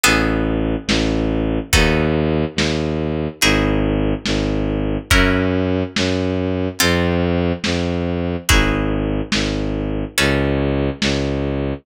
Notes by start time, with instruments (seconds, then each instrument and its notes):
0.04 violin A1, acoustic guitar (steel) B3 C#4 G#4 A4, closed hi-hat
0.87 violin A1, snare
1.73 violin D#2, acoustic guitar (steel) B3 D#4 F#4 A4, kick, closed hi-hat
2.56 violin D#2, snare
3.41 violin G#1, acoustic guitar (steel) D#4 E4 F#4 G#4, closed hi-hat
4.26 violin G#1, snare
5.10 violin F#2, acoustic guitar (steel) C#4 E4 F#4 A#4, kick, closed hi-hat
5.96 violin F#2, snare
6.79 violin F2, acoustic guitar (steel) C4 F4 A4, closed hi-hat
7.64 violin F2, snare
8.49 violin G#1, acoustic guitar (steel) D#4 E4 F#4 G#4, kick, closed hi-hat
9.32 violin G#1, snare
10.18 violin C#2, acoustic guitar (steel) C#4 G#4 A4 B4, closed hi-hat
11.02 violin C#2, snare